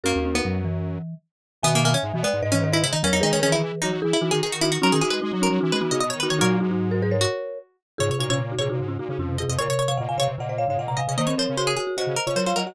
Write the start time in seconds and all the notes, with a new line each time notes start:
0.03 F#2 A#3 C#4 F#4 A#4
0.15 D#2 C#4
0.25 C#4
0.35 B3 D#4
0.44 F#2 F#3
0.65 E3
1.62 B2 D#3 B3 E5 G#5
1.75 A#3
1.84 A#3 E5 G#5
1.94 C#4
2.03 G#2
2.14 B2 E3
2.23 G#3 B3 D5
2.33 G#2
2.42 G#2 B4 D#5
2.52 E3 C#4
2.63 D#3 B4 D#5
2.73 E4 B4 D#5
2.83 C#3 E4
2.93 D#3 D#4
3.03 E2 F#3 C#4 A#4 C#5
3.13 E2 D#4
3.21 D#3 G#3 D#4 G#4 B4
3.33 D#3 C#4
3.42 D#3 E3 C#4 G#4 B4
3.52 D#3 E4
3.63 E3
3.82 F#3 D#4 F#4
3.92 F#3
4.02 E3 E4 G#4
4.13 E4
4.21 E3 D#4 F#4
4.31 D#3 D#4 F#4 G#4
4.43 D#3 G#4
4.52 F#4
4.61 D#4 E4 F#4
4.72 F#4
4.82 F#3 C#4 D#4 F#4 A#4
4.92 D#3 G#4
5.01 E3 D#4 F#4 G#4
5.10 G#3 B4
5.22 G#3 D#4
5.31 F#3 D#4
5.41 C#4 D#4 F#4 A#4
5.50 F#3
5.61 E3 D#4 F#4
5.72 G#3 B4
5.81 E3 B3 D#4 F#4
5.91 C#3 D#4 F#4 D#5
6.00 B2 D#5
6.10 D#3 C#5
6.20 D#3 D#4 F#4 B4
6.30 D#3 C#5
6.39 A#2 F#3 D#4 F#4 A#4 C#5
6.60 G#2 D#4 F#4
6.71 D#4 F#4
6.91 F#4 A#4
7.02 G#4 B4
7.11 A#4 C#5
7.21 F#4
7.98 G#2 C#3 F4 G#4 C#5
8.10 C3 C#5
8.18 A#2 D#4 F#4 C#5
8.29 C3 C#4 F4 C#5
8.39 C#3
8.51 D#4 F#4
8.59 A#2 C3 F4 G#4 C#5
8.69 A#2 C3 D#4 F#4
8.79 G#2 C#3
8.88 C#4 F4
8.99 A#2 D#4 F#4
9.09 C#3 D#4 F#4
9.18 F2 C#4 F4
9.29 C3
9.38 C3 F4 G#4 D#5
9.48 F2 C3 D#5
9.59 A#2 C#3 A#4 C#5
9.69 C3 C#5
9.79 C#5
9.88 C3 C#5 F5
9.97 A#2 C#3 D#5 F#5
10.09 A#2 F5 G#5
10.18 C3 C#5 F5
10.28 C3
10.38 A#2 C#3 D#5 F#5
10.49 C5 D#5
10.58 C#5 F5
10.68 G#2 C#3 C#5 F5
10.77 A#2 D#5 F#5
10.88 C3 F#5 A#5
10.97 C3 D#5 F5 G#5
11.08 C3 C#3 D#5
11.18 D#3 A#3 C5 D#5
11.27 C4 C#5
11.37 F3 C4 A#4 C5 C#5
11.49 C#3
11.57 F#4 C5
11.67 G#4
11.77 F#4 G#4
11.87 F#4
11.97 C#3 F#4 C5 D#5
12.06 C#3
12.16 A#4
12.26 C#3 F4 C#5
12.35 F#3 A#4 C5 C#5
12.46 F4 C5 C#5 F5
12.56 F#3 A#4 D#5 F#5
12.67 F#4 D#5 F#5